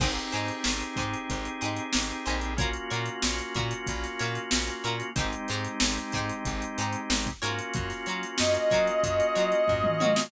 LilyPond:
<<
  \new Staff \with { instrumentName = "Brass Section" } { \time 4/4 \key aes \mixolydian \tempo 4 = 93 r1 | r1 | r1 | r4 ees''2. | }
  \new Staff \with { instrumentName = "Pizzicato Strings" } { \time 4/4 \key aes \mixolydian <ees' g' aes' c''>8 <ees' g' aes' c''>4 <ees' g' aes' c''>4 <ees' g' aes' c''>4 <ees' g' aes' c''>8 | <f' ges' bes' des''>8 <f' ges' bes' des''>4 <f' ges' bes' des''>4 <f' ges' bes' des''>4 <f' ges' bes' des''>8 | <ees' g' aes' c''>8 <ees' g' aes' c''>4 <ees' g' aes' c''>4 <ees' g' aes' c''>4 <f' ges' bes' des''>8~ | <f' ges' bes' des''>8 <f' ges' bes' des''>4 <f' ges' bes' des''>4 <f' ges' bes' des''>4 <f' ges' bes' des''>8 | }
  \new Staff \with { instrumentName = "Drawbar Organ" } { \time 4/4 \key aes \mixolydian <c' ees' g' aes'>1 | <bes des' f' ges'>1 | <aes c' ees' g'>2.~ <aes c' ees' g'>8 <bes des' f' ges'>8~ | <bes des' f' ges'>1 | }
  \new Staff \with { instrumentName = "Electric Bass (finger)" } { \clef bass \time 4/4 \key aes \mixolydian aes,,8 aes,8 aes,,8 aes,8 aes,,8 aes,8 aes,,8 bes,,8~ | bes,,8 bes,8 bes,,8 bes,8 bes,,8 bes,8 bes,,8 bes,8 | aes,,8 aes,8 aes,,8 aes,8 aes,,8 aes,8 aes,,8 aes,8 | ges,8 ges8 ges,8 ges8 ges,8 ges8 ges,8 ges8 | }
  \new DrumStaff \with { instrumentName = "Drums" } \drummode { \time 4/4 <cymc bd>16 hh16 <hh sn>16 hh16 sn16 hh16 <hh bd>16 hh16 <hh bd>16 hh16 hh16 hh16 sn16 hh16 hh16 hh16 | <hh bd>16 hh16 hh16 hh16 sn16 hh16 <hh bd>16 hh16 <hh bd>16 <hh sn>16 <hh sn>16 hh16 sn16 hh16 hh16 hh16 | <hh bd>16 hh16 hh16 hh16 sn16 hh16 <hh bd sn>16 hh16 <hh bd>16 hh16 hh16 hh16 sn16 <hh bd>16 hh16 hh16 | <hh bd>16 <hh sn>16 hh16 hh16 sn16 hh16 <hh bd sn>16 hh16 <hh bd>16 hh16 hh16 hh16 <bd tomfh>16 toml16 tommh16 sn16 | }
>>